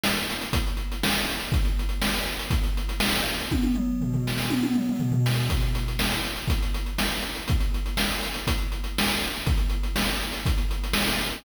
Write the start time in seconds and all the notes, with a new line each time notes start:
0.04 snare
0.17 closed hi-hat
0.30 closed hi-hat
0.41 closed hi-hat
0.53 kick, closed hi-hat
0.67 closed hi-hat
0.77 closed hi-hat
0.92 closed hi-hat
1.03 snare
1.15 closed hi-hat
1.30 closed hi-hat
1.41 closed hi-hat
1.52 kick, closed hi-hat
1.65 closed hi-hat
1.79 closed hi-hat
1.89 closed hi-hat
2.02 snare
2.15 closed hi-hat
2.28 closed hi-hat
2.39 closed hi-hat
2.51 kick, closed hi-hat
2.64 closed hi-hat
2.77 closed hi-hat
2.89 closed hi-hat
3.00 snare
3.16 closed hi-hat
3.26 closed hi-hat
3.40 closed hi-hat
3.51 kick, high tom
3.63 high tom
3.75 mid tom
4.01 floor tom
4.13 floor tom
4.27 snare
4.38 snare
4.50 high tom
4.63 high tom
4.75 mid tom
4.89 mid tom
5.00 floor tom
5.12 floor tom
5.26 snare
5.50 kick, closed hi-hat
5.61 closed hi-hat
5.75 closed hi-hat
5.88 closed hi-hat
5.99 snare
6.12 closed hi-hat
6.24 closed hi-hat
6.36 closed hi-hat
6.48 kick, closed hi-hat
6.63 closed hi-hat
6.74 closed hi-hat
6.86 closed hi-hat
6.98 snare
7.12 closed hi-hat
7.23 closed hi-hat
7.35 closed hi-hat
7.48 kick, closed hi-hat
7.60 closed hi-hat
7.74 closed hi-hat
7.86 closed hi-hat
7.97 snare
8.11 closed hi-hat
8.23 closed hi-hat
8.34 closed hi-hat
8.47 kick, closed hi-hat
8.58 closed hi-hat
8.72 closed hi-hat
8.84 closed hi-hat
8.98 snare
9.10 closed hi-hat
9.22 closed hi-hat
9.35 closed hi-hat
9.47 kick, closed hi-hat
9.58 closed hi-hat
9.70 closed hi-hat
9.83 closed hi-hat
9.96 snare
10.09 closed hi-hat
10.21 closed hi-hat
10.33 closed hi-hat
10.46 kick, closed hi-hat
10.58 closed hi-hat
10.71 closed hi-hat
10.84 closed hi-hat
10.93 snare
11.07 closed hi-hat
11.19 closed hi-hat
11.32 closed hi-hat